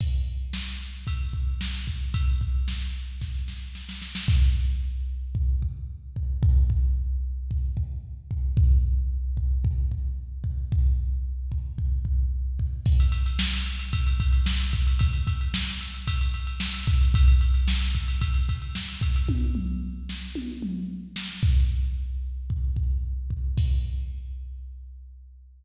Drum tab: CC |x---------------|----------------|x---------------|----------------|
RD |--------x-------|x---------------|----------------|----------------|
SD |----o-------o---|----o---o-o-oooo|----------------|----------------|
T1 |----------------|----------------|----------------|----------------|
T2 |----------------|----------------|----------------|----------------|
BD |o-------o-o---o-|o-o-----o-------|o-------o-o---o-|o-o-----o-o---o-|

CC |----------------|----------------|x---------------|----------------|
RD |----------------|----------------|-xxx-xxxxxxx-xxx|xxxx-xxxxxxx-xxx|
SD |----------------|----------------|----o-------o---|----o-------o---|
T1 |----------------|----------------|----------------|----------------|
T2 |----------------|----------------|----------------|----------------|
BD |o-----o-o-o---o-|o-----o-o-o---o-|o-------o-o---o-|o-o-----o-----o-|

CC |----------------|----------------|x---------------|x---------------|
RD |xxxx-xxxxxxx-xxx|----------------|----------------|----------------|
SD |----o-------o---|------o-------o-|----------------|----------------|
T1 |----------------|o-------o-------|----------------|----------------|
T2 |----------------|--o-------o-----|----------------|----------------|
BD |o-----o-o-o---o-|o---------------|o-------o-o---o-|o---------------|